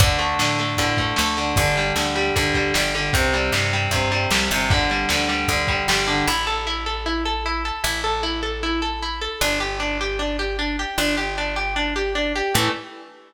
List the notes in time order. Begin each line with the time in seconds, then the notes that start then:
0.00 D2 D3, kick, ride
0.19 A3, ride
0.39 A2 D3, snare
0.59 A3, ride
0.77 A2 D3, kick, ride
0.97 A3, kick, ride
1.16 D2 A3, snare
1.37 D3, ride
1.56 G1 D3, kick, ride
1.76 G3, ride
1.96 D2 D3, snare
2.15 G3, ride
2.36 D2 D3, kick, ride
2.54 G3, kick, ride
2.74 G1 G3, snare
2.95 D3, ride
3.13 C2 C3, kick, ride
3.33 G3, ride
3.52 G2 C3, snare
3.73 G3, ride
3.91 G2 C3, kick, ride
4.12 G3, ride
4.30 C2 G3, snare
4.50 G1 C3, ride
4.70 D3, kick, ride
4.90 G3, ride
5.09 D2 D3, snare
5.29 G3, ride
5.48 D2 D3, kick, ride
5.67 G3, kick, ride
5.88 G1 G3, snare
6.07 D3, ride
6.27 A1 E4
6.47 A4
6.67 E4
6.86 A4
7.06 E4
7.25 A4
7.46 E4
7.65 A4
7.84 A1 E4
8.04 A4
8.23 E4
8.43 A4
8.63 E4
8.82 A4
9.03 E4
9.21 A4
9.41 G1 D4
9.60 G4
9.80 D4
10.01 G4
10.19 D4
10.39 G4
10.59 D4
10.79 G4
10.98 G1 D4
11.17 G4
11.38 D4
11.56 G4
11.76 D4
11.96 G4
12.15 D4
12.36 G4
12.54 A2 E3 A3